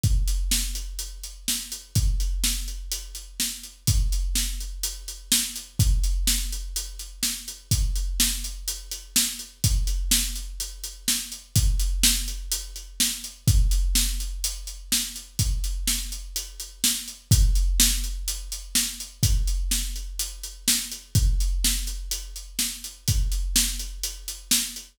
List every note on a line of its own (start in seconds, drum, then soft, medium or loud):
0.03 kick medium
0.03 closed hi-hat medium
0.28 closed hi-hat medium
0.51 snare medium
0.75 closed hi-hat medium
0.99 closed hi-hat medium
1.24 closed hi-hat medium
1.48 snare medium
1.72 closed hi-hat medium
1.95 kick medium
1.95 closed hi-hat medium
2.20 closed hi-hat medium
2.44 snare medium
2.68 closed hi-hat soft
2.92 closed hi-hat medium
3.15 closed hi-hat medium
3.40 snare medium
3.63 closed hi-hat soft
3.87 kick medium
3.87 closed hi-hat medium
4.12 closed hi-hat medium
4.35 snare medium
4.60 closed hi-hat medium
4.83 closed hi-hat medium
5.08 closed hi-hat medium
5.32 snare loud
5.56 closed hi-hat medium
5.79 kick medium
5.79 closed hi-hat medium
6.04 closed hi-hat medium
6.27 snare medium
6.52 closed hi-hat medium
6.76 closed hi-hat medium
6.99 closed hi-hat medium
7.23 snare medium
7.48 closed hi-hat medium
7.71 kick medium
7.71 closed hi-hat medium
7.96 closed hi-hat medium
8.20 snare loud
8.44 closed hi-hat medium
8.68 closed hi-hat medium
8.91 closed hi-hat medium
9.16 snare loud
9.39 closed hi-hat medium
9.64 kick medium
9.64 closed hi-hat medium
9.87 closed hi-hat medium
10.11 snare loud
10.36 closed hi-hat medium
10.60 closed hi-hat medium
10.84 closed hi-hat medium
11.08 snare medium
11.32 closed hi-hat medium
11.56 kick medium
11.56 closed hi-hat medium
11.80 closed hi-hat medium
12.03 snare loud
12.28 closed hi-hat medium
12.52 closed hi-hat medium
12.76 closed hi-hat medium
13.00 snare medium
13.24 closed hi-hat medium
13.48 kick loud
13.48 closed hi-hat medium
13.71 closed hi-hat medium
13.95 snare medium
14.20 closed hi-hat medium
14.44 closed hi-hat medium
14.67 closed hi-hat medium
14.92 snare medium
15.16 closed hi-hat medium
15.39 kick medium
15.39 closed hi-hat medium
15.64 closed hi-hat medium
15.87 snare medium
16.12 closed hi-hat medium
16.36 closed hi-hat medium
16.60 closed hi-hat medium
16.84 snare medium
17.08 closed hi-hat medium
17.31 kick loud
17.31 closed hi-hat loud
17.55 closed hi-hat medium
17.80 snare loud
18.04 closed hi-hat medium
18.28 closed hi-hat medium
18.52 closed hi-hat medium
18.75 snare medium
19.00 closed hi-hat medium
19.23 kick medium
19.23 closed hi-hat medium
19.47 closed hi-hat medium
19.71 snare medium
19.96 closed hi-hat medium
20.19 closed hi-hat medium
20.43 closed hi-hat medium
20.68 snare loud
20.92 closed hi-hat medium
21.15 kick medium
21.15 closed hi-hat medium
21.40 closed hi-hat medium
21.64 snare medium
21.87 closed hi-hat medium
22.11 closed hi-hat medium
22.36 closed hi-hat medium
22.59 snare medium
22.84 closed hi-hat medium
23.08 kick medium
23.08 closed hi-hat medium
23.32 closed hi-hat medium
23.56 snare loud
23.79 closed hi-hat medium
24.03 closed hi-hat medium
24.28 closed hi-hat medium
24.51 snare loud
24.76 closed hi-hat medium